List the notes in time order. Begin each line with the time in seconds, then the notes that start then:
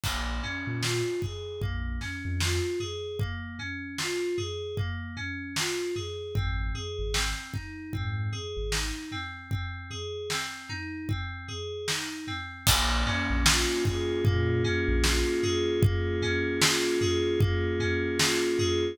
0.03 A#1 A#3, kick, crash
0.43 C#4, floor tom
0.67 A#2
0.82 F4, snare
1.22 G#4, kick, floor tom
1.62 A#1 A#3, kick, floor tom
2.01 C#4, snare, floor tom
2.25 F2
2.40 F4, snare
2.80 G#4, floor tom
3.19 A#3, kick, floor tom
3.59 C#4, floor tom
3.98 F4, snare
4.38 G#4, floor tom
4.77 A#3, kick, floor tom
5.17 C#4, floor tom
5.56 F4, snare
5.96 G#4, floor tom
6.35 G#1 C4, kick, floor tom
6.75 G#4, floor tom
6.99 G#1
7.14 C4, snare
7.53 D#4, kick, floor tom
7.93 G#2 C4, kick, floor tom
8.32 G#4, floor tom
8.57 G#1
8.72 D#4, snare
9.12 C4, floor tom
9.51 C4, kick, floor tom
9.90 G#4, floor tom
10.30 C4, snare
10.69 D#4, floor tom
11.09 C4, kick, floor tom
11.48 G#4, floor tom
11.88 D#4, snare
12.27 C4, floor tom
12.67 A#1 A#3, kick, crash
13.06 C#4, floor tom
13.30 A#1
13.46 F4, snare
13.85 G#4, kick, floor tom
14.25 A#2 A#3, kick, floor tom
14.64 C#4, floor tom
14.88 A#1
15.04 F4, snare
15.43 G#4, floor tom
15.82 A#3, kick, floor tom
16.22 C#4, floor tom
16.61 F4, snare
17.01 G#4, floor tom
17.40 A#3, kick, floor tom
17.80 C#4, floor tom
18.19 F4, snare
18.59 G#4, floor tom